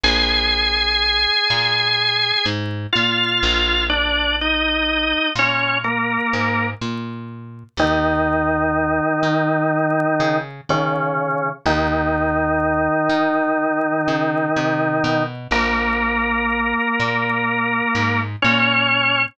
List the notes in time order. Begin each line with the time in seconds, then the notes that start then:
0.03 A#1 G#4 G#5
1.50 A#2
2.46 G#2
2.93 A#2 F4 F5
3.43 A#1
3.89 D4 D5
4.41 D#4 D#5
5.35 A#2 C#4 C#5
5.84 A#3 A#4
6.33 G#2
6.81 A#2
7.77 D#2 D#3 D#4
9.23 D#3
10.20 C#3
10.69 C#3 D#3 C#4
11.66 D#2 D#3 D#4
13.09 D#3
14.08 C#3
14.56 C3
15.04 B2
15.51 A#1 A#3 A#4
17.00 A#2
17.95 G#2
18.42 A#2 C#4 C#5